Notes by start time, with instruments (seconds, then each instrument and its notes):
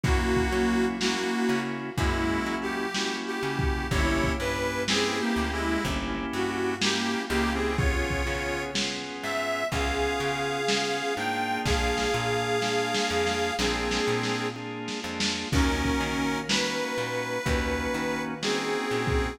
0.03 electric bass (finger) F#2, drawbar organ A#3 C#4 E4 F#4, harmonica A#3 F#4, kick, closed hi-hat
0.36 kick
0.52 electric bass (finger) F#3, drawbar organ A#3 C#4 E4 F#4
0.69 closed hi-hat
1.00 harmonica A#3 F#4, drawbar organ A#3 C#4 E4 F#4, snare
1.49 electric bass (finger) C#3
1.65 closed hi-hat
1.97 electric bass (finger) F#2, harmonica G#3 E4, drawbar organ A#3 C#4 E4 F#4, kick, closed hi-hat
2.46 electric bass (finger) F#3
2.62 harmonica G4, closed hi-hat
2.95 drawbar organ A#3 C#4 E4 F#4, snare
3.27 harmonica G4
3.43 electric bass (finger) C#3, drawbar organ A#3 C#4 E4 F#4
3.59 kick, closed hi-hat
3.91 electric bass (finger) G1, drawbar organ A#3 C#4 E4 G4, harmonica E4 C#5, kick, closed hi-hat
4.24 kick
4.40 electric bass (finger) G2, drawbar organ A#3 C#4 E4 G4, harmonica B4
4.55 closed hi-hat
4.88 drawbar organ A#3 C#4 E4 G4, harmonica C4 G#4, snare
5.20 harmonica A#3 G4
5.36 electric bass (finger) D2
5.52 harmonica G#3 E4, closed hi-hat
5.84 electric bass (finger) G1, drawbar organ A#3 C#4 E4 G4, kick, closed hi-hat
6.33 electric bass (finger) G2, harmonica F#4
6.49 closed hi-hat
6.81 drawbar organ A#3 C#4 E4 G4, harmonica A#3 G4, snare
7.29 electric bass (finger) C#2, harmonica A#3 G4, drawbar organ A#3 C#4 E4 G4
7.46 closed hi-hat
7.54 harmonica C4 G#4
7.78 drawbar organ B3 C#4 F4 G#4, harmonica F4 C#5, kick, closed hi-hat
8.10 kick
8.26 electric bass (finger) C#3, drawbar organ B3 C#4 F4 G#4
8.43 closed hi-hat
8.74 drawbar organ B3 C#4 F4 G#4, snare
9.23 electric bass (finger) G#2, harmonica E5
9.39 closed hi-hat
9.72 electric bass (finger) C#2, drawbar organ B3 C#4 F4 G#4, harmonica G#4 F5, kick, closed hi-hat
10.20 electric bass (finger) C#3
10.36 closed hi-hat
10.68 drawbar organ B3 C#4 F4 G#4, snare
11.17 electric bass (finger) G#2, drawbar organ A#3 D4 F4 G#4, harmonica G5
11.33 closed hi-hat
11.65 electric bass (finger) A#1, harmonica G#4 F5, kick, snare
11.98 snare
12.14 electric bass (finger) A#2, drawbar organ A#3 D4 F4 G#4
12.62 drawbar organ A#3 D4 F4 G#4, snare
12.94 snare
13.10 electric bass (finger) F2
13.27 snare
13.59 electric bass (finger) A#1, drawbar organ A#3 D4 F4 G#4, harmonica C4 G#4, snare
13.91 snare
14.07 electric bass (finger) A#2
14.23 snare
14.56 drawbar organ A#3 D4 F4 G#4
14.88 snare
15.04 electric bass (finger) F2, drawbar organ A#3 D4 F4 G#4
15.20 snare
15.52 electric bass (finger) D#2, drawbar organ A#3 C#4 D#4 F#4, harmonica C#4 A#4, kick, crash
15.85 kick
16.00 electric bass (finger) D#3
16.17 closed hi-hat
16.49 drawbar organ A#3 C#4 D#4 F#4, harmonica B4, snare
16.98 electric bass (finger) A#2
17.14 closed hi-hat
17.45 electric bass (finger) D#2, drawbar organ A#3 C#4 D#4 F#4, kick, closed hi-hat
17.94 electric bass (finger) D#3
18.10 closed hi-hat
18.42 drawbar organ A#3 C#4 D#4 F#4, harmonica C4 G#4, snare
18.91 electric bass (finger) A#2, drawbar organ A#3 C#4 D#4 F#4
19.07 kick, closed hi-hat